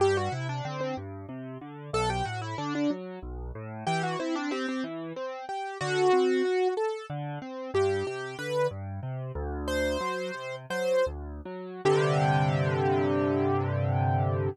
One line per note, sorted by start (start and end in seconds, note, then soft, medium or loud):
0.00 0.29 G2 medium
0.00 0.16 G4 loud
0.17 0.32 F#4 medium
0.32 0.61 C3 medium
0.32 0.47 E4 medium
0.49 0.64 D4 medium
0.65 0.94 D3 medium
0.65 0.80 C4 medium
0.81 0.96 C4 medium
0.97 1.26 G2 medium
1.29 1.58 C3 medium
1.61 1.90 D3 medium
1.93 2.22 B1 medium
1.93 2.09 A4 loud
2.10 2.25 G4 medium
2.25 2.55 A2 medium
2.25 2.41 F#4 medium
2.42 2.57 E4 medium
2.58 2.87 D3 medium
2.58 2.73 D4 medium
2.75 2.90 D4 medium
2.90 3.19 F#3 medium
3.22 3.51 B1 medium
3.55 3.84 A2 medium
3.87 4.16 E3 medium
3.87 4.02 G4 loud
4.03 4.19 F#4 medium
4.19 4.48 C4 medium
4.19 4.35 E4 medium
4.35 4.51 D4 medium
4.51 4.66 C4 loud
4.51 4.81 G4 medium
4.68 4.84 C4 medium
4.84 5.13 E3 medium
5.16 5.45 C4 medium
5.49 5.78 G4 medium
5.81 6.10 D3 medium
5.81 6.68 F#4 loud
6.13 6.42 C4 medium
6.45 6.74 F#4 medium
6.77 7.06 A4 medium
7.10 7.39 D3 medium
7.42 7.71 C4 medium
7.74 8.03 G2 medium
7.74 8.06 G4 medium
8.07 8.36 C3 medium
8.07 8.37 G4 medium
8.39 8.68 D3 medium
8.39 8.67 B4 medium
8.71 9.00 G2 medium
9.03 9.32 C3 medium
9.35 9.97 D2 medium
9.68 10.56 C5 medium
10.01 10.31 F#3 medium
10.34 10.66 C3 medium
10.70 11.03 F#3 medium
10.70 11.05 C5 medium
11.07 11.41 D2 medium
11.45 11.81 F#3 medium
11.85 14.49 G2 medium
11.85 14.49 C3 loud
11.85 14.49 D3 loud
11.85 14.49 G4 loud